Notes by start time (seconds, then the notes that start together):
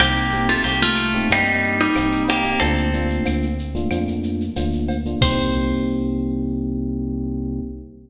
0.00 C2 A#3 C4 D#4 G4, cowbell, claves, shaker
0.16 shaker
0.32 A#3 C4 D#4 G4, shaker
0.49 A3 F4, shaker
0.64 C2 A#3 G4, cowbell, shaker
0.82 A3 F4, shaker
0.98 claves, shaker
1.13 A#3 C4 D#4 G4, shaker
1.30 G2 G3 A#3 C4 D#4 G4, cowbell, shaker
1.47 shaker
1.63 shaker
1.79 G3 D#4, shaker
1.96 C2 A#3 C4 D#4 G4, cowbell, claves, shaker
2.12 shaker
2.28 A#3 G4, cowbell, shaker
2.44 A#3 C4 D#4 G4, shaker
2.60 D2 A3 A#3 C4 D4 F4 A4, cowbell, shaker
2.77 shaker
2.93 A3 A#3 D4 F4, shaker
3.09 shaker
3.26 D2, cowbell, claves, shaker
3.43 shaker
3.59 shaker
3.75 A3 A#3 D4 F4, shaker
3.91 F2 A3 A#3 D4 F4, cowbell, claves, shaker
4.08 shaker
4.23 shaker
4.40 shaker
4.56 D2 A3 A#3 D4 F4, cowbell, shaker
4.73 shaker
4.88 cowbell, shaker
5.05 A3 A#3 D4 F4, shaker
5.21 C2 A#3 C4 D#4 G4 C5, kick, crash